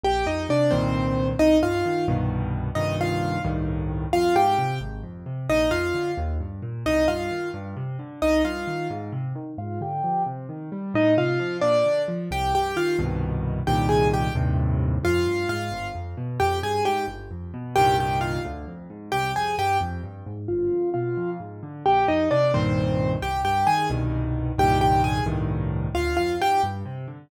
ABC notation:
X:1
M:6/8
L:1/8
Q:3/8=88
K:Cm
V:1 name="Acoustic Grand Piano"
[Gg] [Ee] [Dd] [Cc]3 | [Ee] [Ff]2 z3 | [Ee] [Ff]2 z3 | [Ff] [Gg]2 z3 |
[Ee] [Ff]2 z3 | [Ee] [Ff]2 z3 | [Ee] [Ff]2 z3 | [Ff] [Gg]2 z3 |
[Ee] [Ff]2 [Dd]2 z | [Gg] [Gg] [Ff] z3 | [Gg] [Aa] [Gg] z3 | [Ff]2 [Ff]2 z2 |
[Gg] [Aa] [Gg] z3 | [Gg] [Gg] [Ff] z3 | [Gg] [Aa] [Gg] z3 | [Ff]2 [Ff]2 z2 |
[Gg] [Ee] [Dd] [Cc]3 | [Gg] [Gg] [Aa] z3 | [Gg] [Gg] [Aa] z3 | [Ff] [Ff] [Gg] z3 |]
V:2 name="Acoustic Grand Piano" clef=bass
B,,, F,, C, [C,,G,,B,,E,]3 | C,, G,, E, [C,,G,,=B,,E,]3 | [C,,G,,B,,E,]3 [C,,G,,=A,,E,]3 | F,, A,, C, A,,, F,, C, |
B,,, F,, D, E,, G,, B,, | C,, G,, E, G,, C, D, | C,, G,, E, A,, C, E, | A,, D, F, C, E, G, |
=A,, C, F, B,, D, F, | C,, G,, E, [C,,G,,=B,,E,]3 | [C,,G,,B,,E,]3 [E,,G,,=A,,C,]3 | F,, G,, A,, G,,, F,, =B,, |
F,, G,, A,, G,,, F,, =B,, | [C,,G,,B,,E,]3 D,, F,, A,, | C,, F,, G,, F,, G,, A,, | G,,, F,, =B,, F,, A,, D, |
B,,, F,, C, [C,,G,,B,,E,]3 | C,, G,, E, [C,,G,,=B,,E,]3 | [C,,G,,B,,E,]3 [C,,G,,=A,,E,]3 | D,, F,, A,, G,, C, D, |]